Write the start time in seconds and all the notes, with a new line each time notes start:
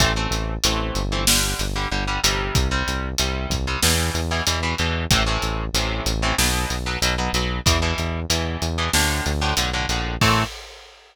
0.00 A1 E3 A3 C4, kick, closed hi-hat
0.16 E3 A3 C4
0.31 A1, closed hi-hat
0.64 A1 E3 A3 C4, closed hi-hat
0.95 G1, closed hi-hat
1.12 E3 A3 C4
1.27 D3 G3, snare
1.59 G1, closed hi-hat
1.76 D3 G3
1.91 G1 D3 G3
2.07 D3 G3
2.23 G1 C3 G3, closed hi-hat
2.55 C2, kick, closed hi-hat
2.71 C3 G3
2.88 C2, closed hi-hat
3.18 C2 C3 G3, closed hi-hat
3.50 C2, kick, closed hi-hat
3.67 C3 G3
3.83 E2 B2 E3, snare
4.14 E2, closed hi-hat
4.31 B2 E3
4.47 E2 B2 E3, closed hi-hat
4.63 B2 E3
4.78 E2 B2 E3, closed hi-hat
5.11 A1 A2 C3 E3, kick, closed hi-hat
5.26 A2 C3 E3
5.42 A1, closed hi-hat
5.73 A1 A2 C3 E3, closed hi-hat
6.06 A1, closed hi-hat
6.22 A2 C3 E3
6.38 B1 B2 F#3, snare
6.70 B1, closed hi-hat
6.86 B2 F#3
7.02 B1 B2 F#3, closed hi-hat
7.18 B2 F#3
7.33 B1 B2 F#3, closed hi-hat
7.66 E2 B2 E3, kick, closed hi-hat
7.82 B2 E3
7.98 E2, closed hi-hat
8.30 E2 B2 E3, closed hi-hat
8.62 E2, closed hi-hat
8.78 B2 E3
8.93 D2 A2 D3, snare
9.26 D2, closed hi-hat
9.41 A2 D3
9.57 B1 A2 D3, closed hi-hat
9.73 A2 D3
9.89 A#1 A2 D3, closed hi-hat
10.21 A2 E3 A3 C4, kick, crash